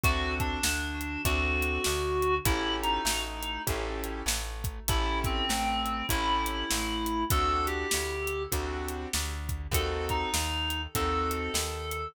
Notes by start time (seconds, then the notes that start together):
0.04 D2 C4 D4 F#4 A4, kick, closed hi-hat
0.40 D4, kick, closed hi-hat
0.63 D2 D3, snare
1.01 closed hi-hat
1.25 D2 C4 D4 F#4 A4, kick, closed hi-hat
1.63 closed hi-hat
1.84 D2 D3, snare
2.22 closed hi-hat
2.45 A1 C#4 E4 G4 A4, kick, closed hi-hat
2.82 D#4, closed hi-hat
3.05 A1 A3, snare
3.43 closed hi-hat
3.67 A1 C#4 E4 G4 A4, kick, closed hi-hat
4.04 closed hi-hat
4.26 A1 A3, snare
4.64 kick, closed hi-hat
4.88 A1 C#4 E4 G4 A4, kick, closed hi-hat
5.24 C4, kick, closed hi-hat
5.49 A1 A3, snare
5.86 closed hi-hat
6.09 A1 C#4 E4 G4 A4, kick, closed hi-hat
6.46 closed hi-hat
6.70 A1 A3, snare
7.06 closed hi-hat
7.30 D2 C4 D4 F#4 A4, kick, closed hi-hat
7.67 G4, closed hi-hat
7.91 D2 D3, snare
8.27 closed hi-hat
8.52 D2 C4 D4 F#4 A4, kick, closed hi-hat
8.89 closed hi-hat
9.13 D2 D3, snare
9.49 kick, closed hi-hat
9.71 D#2 C4 D#4 F#4 A4, kick, closed hi-hat
10.09 D#4, kick, closed hi-hat
10.34 D#2 D#3, snare
10.70 closed hi-hat
10.95 D#2 C4 D#4 F#4 A4, kick, closed hi-hat
11.31 closed hi-hat
11.54 D#2 D#3, snare
11.91 closed hi-hat